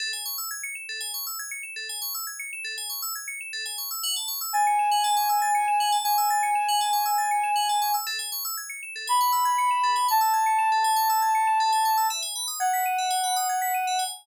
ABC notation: X:1
M:4/4
L:1/16
Q:1/4=119
K:E
V:1 name="Ocarina"
z16 | z16 | z4 g12 | g16 |
z8 b8 | a16 | z4 f12 |]
V:2 name="Electric Piano 2"
A g c' e' g' c'' e'' A g c' e' g' c'' e'' A g | c' e' g' c'' e'' A g c' e' g' c'' e'' A g c' e' | f a c' e' a' c'' e'' f a c' e' a' c'' e'' f a | c' e' a' c'' e'' f a c' e' a' c'' e'' f a c' e' |
A g c' e' g' c'' e'' A g c' e' g' c'' e'' A g | c' e' g' c'' e'' A g c' e' g' c'' e'' A g c' e' | e g b d' g' b' d'' e g b d' g' b' d'' e g |]